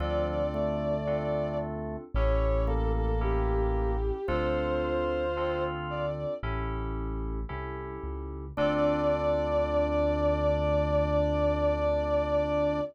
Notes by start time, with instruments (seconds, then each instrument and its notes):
0.00 synth bass 1 D2, drawbar organ F3, electric piano 2 C4 D4 F4 A4, violin D5
0.54 drawbar organ A3
1.07 electric piano 2 C4 D4 F4 A4
2.14 synth bass 1 A1, electric piano 2 C#4 E4 G4 A4, violin C#5
2.67 drawbar organ A#3, violin A4
2.96 violin A4
3.21 electric piano 2 C#4 E4 G4 A4, violin G4
4.27 synth bass 1 D2, electric piano 2 C4 D4 F4 A4, drawbar organ F4, violin C5
5.37 electric piano 2 C4 D4 F4 A4
5.90 violin D5
6.43 synth bass 1 A1, electric piano 2 C#4 E4 G4 A4
7.49 synth bass 1 C2, electric piano 2 C#4 E4 G4 A4
8.04 synth bass 1 C#2
8.57 synth bass 1 D2, electric piano 2 C4 D4 F4 A4, drawbar organ D4, violin D5